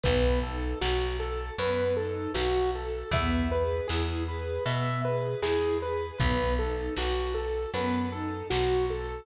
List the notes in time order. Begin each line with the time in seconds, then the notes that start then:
0.03 B1 B3 B4, kick, closed hi-hat
0.43 D#4 A4
0.81 B1 F#4, snare
1.18 A4
1.58 F#2 B3 B4, closed hi-hat
1.96 D#4 A4
2.34 B1 F#4, snare
2.75 A4
3.11 E2 B3 E5, kick, closed hi-hat
3.51 G#4 B4
3.88 E2 E4 G#4, snare
4.27 G#4 B4
4.66 B2 B3 E5, closed hi-hat
5.05 G#4 B4
5.41 E2 E4 G#4, snare
5.81 G#4 B4
6.18 B1 B3 B4, kick, closed hi-hat
6.59 D#4 A4
6.96 B1 F#4, snare
7.34 A4
7.74 F#2 B3 B4, closed hi-hat
8.12 D#4 A4
8.50 B1 F#4, snare
8.90 A4